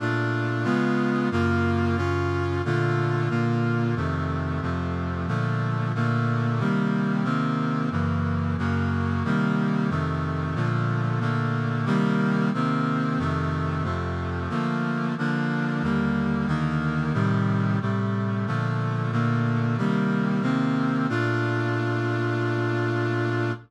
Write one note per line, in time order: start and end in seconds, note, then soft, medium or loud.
0.00 0.65 A#2 medium
0.00 0.65 A3 medium
0.00 0.65 D4 loud
0.00 0.63 F4 medium
0.64 1.29 C#3 medium
0.64 1.29 G#3 loud
0.64 1.29 B3 loud
0.64 1.29 F4 loud
1.31 1.96 F#2 loud
1.31 1.96 C#3 loud
1.31 1.97 A#3 loud
1.31 1.96 F4 loud
1.97 2.62 F#2 medium
1.97 2.62 C#3 medium
1.97 2.62 C#4 loud
1.97 2.62 F4 loud
2.65 3.29 A#2 medium
2.65 3.29 D3 loud
2.65 3.30 A3 medium
2.65 3.29 F4 medium
3.29 3.95 A#2 loud
3.29 3.95 D3 medium
3.29 3.95 A#3 medium
3.29 3.95 F4 medium
3.96 4.61 F2 loud
3.96 4.61 C3 loud
3.96 4.61 D#3 medium
3.96 4.61 A3 medium
4.62 5.27 F2 loud
4.62 5.27 C3 loud
4.62 5.27 F3 medium
4.62 5.27 A3 medium
5.27 5.93 A#2 medium
5.27 5.93 D3 medium
5.27 5.93 F3 medium
5.27 5.93 A3 loud
5.95 6.60 A#2 loud
5.95 6.60 D3 medium
5.95 6.60 A3 loud
5.95 6.59 A#3 medium
6.59 7.23 C3 medium
6.59 7.23 D#3 medium
6.59 7.24 G3 loud
6.59 7.23 A#3 medium
7.24 7.89 C3 loud
7.24 7.89 D#3 loud
7.24 7.89 A#3 medium
7.24 7.89 C4 medium
7.91 8.56 F#2 medium
7.91 8.56 C#3 medium
7.91 8.56 E3 loud
7.91 8.56 A#3 medium
8.58 9.23 F#2 loud
8.58 9.23 C#3 loud
8.58 9.23 F#3 medium
8.58 9.23 A#3 medium
9.24 9.89 C3 loud
9.24 9.89 D#3 loud
9.24 9.90 G3 medium
9.24 9.90 A#3 loud
9.90 10.55 F2 medium
9.90 10.55 C3 medium
9.90 10.55 D#3 loud
9.90 10.54 A3 medium
10.55 11.19 A#2 loud
10.55 11.19 D3 loud
10.55 11.20 F3 loud
10.55 11.19 A3 medium
11.20 11.85 A#2 medium
11.20 11.85 D3 loud
11.20 11.85 A3 medium
11.20 11.85 A#3 medium
11.85 12.51 C3 loud
11.85 12.51 D#3 loud
11.85 12.51 G3 loud
11.85 12.51 A#3 loud
12.54 13.18 C3 loud
12.54 13.18 D#3 loud
12.54 13.19 A#3 medium
12.54 13.19 C4 loud
13.19 13.83 F2 medium
13.19 13.83 C3 loud
13.19 13.84 D#3 loud
13.19 13.83 A3 loud
13.84 14.49 F2 loud
13.84 14.49 C3 loud
13.84 14.49 F3 medium
13.84 14.49 A3 medium
14.49 15.15 D3 medium
14.49 15.15 F3 loud
14.49 15.15 A3 medium
14.49 15.15 A#3 loud
15.18 15.82 D3 loud
15.18 15.83 F3 loud
15.18 15.82 A#3 loud
15.18 15.83 D4 medium
15.83 16.47 D#2 loud
15.83 16.47 D3 medium
15.83 16.48 G3 medium
15.83 16.47 A#3 loud
16.47 17.13 D#2 medium
16.47 17.13 D3 medium
16.47 17.13 D#3 loud
16.47 17.13 A#3 medium
17.13 17.79 A2 loud
17.13 17.79 C3 loud
17.13 17.79 D#3 loud
17.13 17.79 G3 loud
17.81 18.46 A2 medium
17.81 18.46 C3 medium
17.81 18.46 G3 medium
17.81 18.46 A3 medium
18.47 19.11 A#2 medium
18.47 19.11 D3 medium
18.47 19.12 F3 medium
18.47 19.11 A3 loud
19.12 19.77 A#2 loud
19.12 19.77 D3 medium
19.12 19.77 A3 medium
19.12 19.77 A#3 medium
19.78 20.41 C3 loud
19.78 20.41 D#3 medium
19.78 20.43 G3 loud
19.78 20.41 A#3 medium
20.42 21.07 C3 loud
20.42 21.07 D#3 medium
20.42 21.07 A#3 medium
20.42 21.07 C4 loud
21.09 23.52 A#2 loud
21.09 23.52 A3 medium
21.09 23.52 D4 loud
21.09 23.52 F4 loud